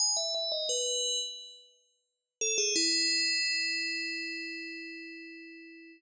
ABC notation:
X:1
M:4/4
L:1/16
Q:1/4=87
K:Emix
V:1 name="Tubular Bells"
g e e ^d B3 z7 A G | [M:5/4] E20 |]